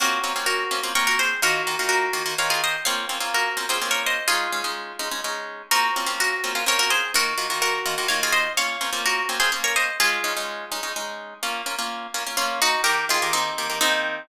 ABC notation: X:1
M:3/4
L:1/16
Q:1/4=126
K:Bbm
V:1 name="Orchestral Harp"
[GB]4 [GB]4 [Bd] [GB] [Ac]2 | [GB]4 [GB]4 [df] [FA] [ce]2 | [df]4 [GB]3 [Ac] z [Bd] [ce]2 | [FA]10 z2 |
[GB]4 [GB]4 [Bd] [GB] [Ac]2 | [GB]4 [GB]4 [df] [FA] [ce]2 | [df]4 [GB]3 [Ac] z [Bd] [ce]2 | [FA]10 z2 |
z8 [DF]2 [EG]2 | [=GB]2 [FA]2 [CE]4 [CE]4 |]
V:2 name="Orchestral Harp"
[B,CDF]2 [B,CDF] [B,CDF]3 [B,CDF] [B,CDF] [B,CDF]4 | [E,B,F]2 [E,B,FG] [E,B,FG]3 [E,B,FG] [E,B,FG] [E,B,FG]4 | [B,CDF]2 [B,CDF] [B,CDF]3 [B,CDF] [B,CDF] [B,CDF]4 | [A,DE]2 [A,DE] [A,DE]3 [A,DE] [A,DE] [A,DE]4 |
[B,CF]2 [B,CDF] [B,CDF]3 [B,CDF] [B,DF] [B,CDF]4 | [E,B,F]2 [E,B,FG] [E,B,FG]3 [E,B,FG] [E,B,FG] [E,B,FG]4 | [B,DF]2 [B,CDF] [B,CDF]3 [B,CDF] [B,CDF] [B,DF]4 | [A,D]2 [A,DE] [A,DE]3 [A,DE] [A,DE] [A,DE]4 |
[B,DF]2 [B,DF] [B,DF]3 [B,DF] [B,DF] B,4 | [E,B,]2 [E,B,=G] [E,B,G]3 [E,B,G] [E,B,G] [E,B,G]4 |]